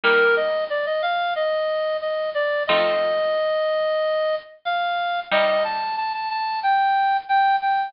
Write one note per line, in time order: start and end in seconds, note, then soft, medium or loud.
0.03 2.41 G3 loud
0.03 2.41 A#3 loud
0.03 2.41 D#4 loud
0.03 0.35 A#4 medium
0.36 0.64 D#5 medium
0.70 0.85 D5 medium
0.86 1.02 D#5 medium
1.02 1.34 F5 medium
1.36 1.97 D#5 medium
2.01 2.30 D#5 medium
2.34 2.63 D5 medium
2.67 5.06 F3 loud
2.67 5.06 A3 loud
2.67 5.06 C4 loud
2.67 5.06 D#4 medium
2.67 4.35 D#5 medium
4.65 5.20 F5 medium
5.31 7.69 C3 loud
5.31 7.69 G3 loud
5.31 7.69 D#4 loud
5.31 5.63 D#5 medium
5.64 5.96 A5 medium
5.97 6.13 A5 medium
6.13 6.29 A5 medium
6.30 6.60 A5 medium
6.63 7.17 G5 medium
7.29 7.56 G5 medium
7.62 7.89 G5 medium